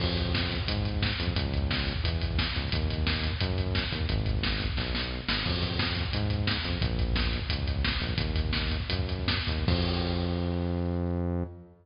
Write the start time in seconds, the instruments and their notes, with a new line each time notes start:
0.00 synth bass 1 F2, kick, crash
0.09 kick
0.17 kick, closed hi-hat
0.25 kick
0.34 kick, snare
0.43 kick
0.50 kick, closed hi-hat
0.60 kick
0.68 synth bass 1 G#2, kick, closed hi-hat
0.77 kick
0.85 kick, closed hi-hat
0.94 kick
1.02 kick, snare
1.12 kick
1.19 synth bass 1 F2, kick, closed hi-hat
1.27 kick
1.36 synth bass 1 C#2, kick, closed hi-hat
1.45 kick
1.54 kick, closed hi-hat
1.62 kick
1.70 kick, snare
1.79 kick
1.87 kick, closed hi-hat
1.96 kick
2.04 synth bass 1 E2, kick, closed hi-hat
2.13 kick
2.21 kick, closed hi-hat
2.31 kick
2.38 kick, snare
2.48 kick
2.55 synth bass 1 C#2, kick, closed hi-hat
2.64 kick
2.72 synth bass 1 D#2, kick, closed hi-hat
2.82 kick
2.90 kick, closed hi-hat
2.98 kick
3.07 kick, snare
3.16 kick
3.23 kick, closed hi-hat
3.32 kick
3.40 synth bass 1 F#2, kick, closed hi-hat
3.50 kick
3.58 kick, closed hi-hat
3.67 kick
3.75 kick, snare
3.84 kick
3.92 synth bass 1 D#2, kick, closed hi-hat
4.01 kick
4.09 synth bass 1 G#1, kick, closed hi-hat
4.17 kick
4.26 kick, closed hi-hat
4.34 kick
4.43 kick, snare
4.52 kick
4.60 kick, closed hi-hat
4.69 kick
4.77 synth bass 1 B1, kick, snare
4.95 snare
5.28 synth bass 1 G#1, snare
5.45 synth bass 1 F2, kick, crash
5.54 kick
5.63 kick, closed hi-hat
5.71 kick
5.79 kick, snare
5.88 kick
5.96 kick, closed hi-hat
6.05 kick
6.13 synth bass 1 G#2, kick, closed hi-hat
6.22 kick
6.30 kick, closed hi-hat
6.39 kick
6.47 kick, snare
6.56 kick
6.64 synth bass 1 F2, kick, closed hi-hat
6.73 kick
6.82 synth bass 1 A#1, kick, closed hi-hat
6.90 kick
6.99 kick, closed hi-hat
7.08 kick
7.16 kick, snare
7.24 kick
7.33 kick, closed hi-hat
7.42 kick
7.50 synth bass 1 C#2, kick, closed hi-hat
7.59 kick
7.67 kick, closed hi-hat
7.76 kick
7.84 kick, snare
7.92 kick
8.00 synth bass 1 A#1, kick, closed hi-hat
8.09 kick
8.17 synth bass 1 D#2, kick, closed hi-hat
8.27 kick
8.35 kick, closed hi-hat
8.45 kick
8.53 kick, snare
8.62 kick
8.71 kick, closed hi-hat
8.80 kick
8.89 synth bass 1 F#2, kick, closed hi-hat
8.99 kick
9.08 kick, closed hi-hat
9.19 kick
9.28 kick, snare
9.38 kick
9.47 synth bass 1 D#2, kick, closed hi-hat
9.59 kick
9.67 synth bass 1 F2, kick, crash